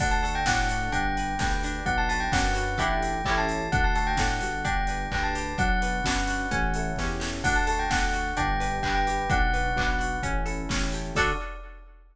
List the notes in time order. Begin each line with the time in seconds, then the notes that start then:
0.00 D2 D4 F#5, kick, crash
0.11 A5
0.23 F#4 A4 A5, open hi-hat
0.35 G5
0.46 A2 D4 A4 F#5, kick, snare
0.69 D4 F#4, open hi-hat
0.92 G1 D4 G5, kick, closed hi-hat
1.16 G4 B4, open hi-hat
1.39 D2 D4 B4 G5, kick, snare
1.51 G5
1.63 D4 G4, open hi-hat
1.86 B1 D4 F#5, kick, closed hi-hat
1.98 A5
2.09 F#4 B4 A5, open hi-hat
2.20 G5
2.32 F#2 D4 B4 F#5, kick, snare
2.55 F#4, open hi-hat
2.78 A1 D4 E4 G4 A4 G5, kick, closed hi-hat
3.02 open hi-hat
3.25 A1 C#4 E4 G4 A4 G5, kick, clap
3.37 A5
3.49 open hi-hat
3.72 D2 D4 F#5, kick, closed hi-hat
3.84 A5
3.95 F#4 A4 A5, open hi-hat
4.07 G5
4.17 A2 D4 A4 F#5, kick, snare
4.41 G1 F#4, open hi-hat
4.65 D4 G5, kick, closed hi-hat
4.87 G4 B4, open hi-hat
5.11 D2 D4 B4 G5, kick, clap
5.23 A5
5.35 G4, open hi-hat
5.58 B1 D4 F#5, kick, closed hi-hat
5.81 F#4 B4, open hi-hat
6.04 F#2 D4 B4, kick, snare
6.27 F#4, open hi-hat
6.51 A1 C#4, kick, closed hi-hat
6.74 E4 A4, open hi-hat
6.96 E2 C#4 G4, kick, snare
7.20 G4 A4, snare
7.44 D2 D4 F#5, kick, crash
7.56 A5
7.67 F#4 A4 A5, open hi-hat
7.79 G5
7.90 D2 D4 A4 F#5, kick, snare
8.13 F#4, open hi-hat
8.37 G1 D4 G5, kick, closed hi-hat
8.60 G4 B4, open hi-hat
8.83 G1 D4 B4 G5, kick, clap
8.95 G5
9.07 G4, open hi-hat
9.30 B1 D4 F#5, kick, closed hi-hat
9.53 F#4 B4, open hi-hat
9.76 B1 D4 B4, kick, clap
9.99 F#4, open hi-hat
10.23 A1 C#4, kick, closed hi-hat
10.46 E4 A4, open hi-hat
10.69 A1 C#4 G4, kick, snare
10.92 G4 A4, open hi-hat
11.15 D2 D4 F#4 A4 D5, kick, crash